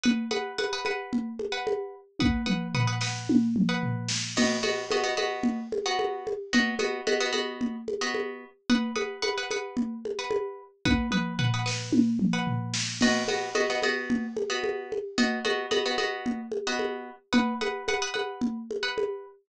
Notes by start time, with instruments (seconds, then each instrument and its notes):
0.03 pizzicato strings B4 F#5 D#6, low conga
0.31 pizzicato strings B4 F#5 D#6, high conga
0.58 pizzicato strings B4 F#5 D#6, high conga
0.73 pizzicato strings B4 F#5 D#6
0.85 pizzicato strings B4 F#5 D#6, high conga
1.13 low conga
1.39 high conga
1.52 pizzicato strings B4 F#5 D#6
1.67 high conga
2.19 pizzicato strings B4 F#5 D#6, kick, high tom
2.46 pizzicato strings B4 F#5 D#6, mid tom
2.75 pizzicato strings B4 F#5 D#6, floor tom
2.87 pizzicato strings B4 F#5 D#6
3.01 pizzicato strings B4 F#5 D#6, snare
3.29 high tom
3.56 mid tom
3.69 pizzicato strings B4 F#5 D#6
3.83 floor tom
4.09 snare
4.36 pizzicato strings B3 F#4 D#5, crash, low conga
4.63 pizzicato strings B3 F#4 D#5, high conga
4.91 pizzicato strings B3 F#4 D#5, high conga
5.03 pizzicato strings B3 F#4 D#5
5.17 pizzicato strings B3 F#4 D#5, high conga
5.43 low conga
5.72 high conga
5.86 pizzicato strings B3 F#4 D#5
5.99 high conga
6.27 high conga
6.53 pizzicato strings B3 F#4 D#5, low conga
6.79 pizzicato strings B3 F#4 D#5, high conga
7.07 pizzicato strings B3 F#4 D#5, high conga
7.20 pizzicato strings B3 F#4 D#5
7.33 pizzicato strings B3 F#4 D#5, high conga
7.61 low conga
7.88 high conga
8.01 pizzicato strings B3 F#4 D#5
8.14 high conga
8.70 pizzicato strings B4 F#5 D#6, low conga
8.96 pizzicato strings B4 F#5 D#6, high conga
9.22 pizzicato strings B4 F#5 D#6, high conga
9.38 pizzicato strings B4 F#5 D#6
9.51 pizzicato strings B4 F#5 D#6, high conga
9.77 low conga
10.05 high conga
10.19 pizzicato strings B4 F#5 D#6
10.31 high conga
10.85 pizzicato strings B4 F#5 D#6, kick, high tom
11.11 pizzicato strings B4 F#5 D#6, mid tom
11.39 pizzicato strings B4 F#5 D#6, floor tom
11.54 pizzicato strings B4 F#5 D#6
11.66 pizzicato strings B4 F#5 D#6, snare
11.92 high tom
12.19 mid tom
12.33 pizzicato strings B4 F#5 D#6
12.47 floor tom
12.74 snare
13.01 pizzicato strings B3 F#4 D#5, crash, low conga
13.28 pizzicato strings B3 F#4 D#5, high conga
13.55 pizzicato strings B3 F#4 D#5, high conga
13.70 pizzicato strings B3 F#4 D#5
13.82 pizzicato strings B3 F#4 D#5, high conga
14.10 low conga
14.37 high conga
14.50 pizzicato strings B3 F#4 D#5
14.64 high conga
14.92 high conga
15.18 pizzicato strings B3 F#4 D#5, low conga
15.45 pizzicato strings B3 F#4 D#5, high conga
15.71 pizzicato strings B3 F#4 D#5, high conga
15.86 pizzicato strings B3 F#4 D#5
15.98 pizzicato strings B3 F#4 D#5, high conga
16.26 low conga
16.52 high conga
16.67 pizzicato strings B3 F#4 D#5
16.79 high conga
17.33 pizzicato strings B4 F#5 D#6, low conga
17.61 pizzicato strings B4 F#5 D#6, high conga
17.88 pizzicato strings B4 F#5 D#6, high conga
18.02 pizzicato strings B4 F#5 D#6
18.14 pizzicato strings B4 F#5 D#6, high conga
18.41 low conga
18.71 high conga
18.83 pizzicato strings B4 F#5 D#6
18.98 high conga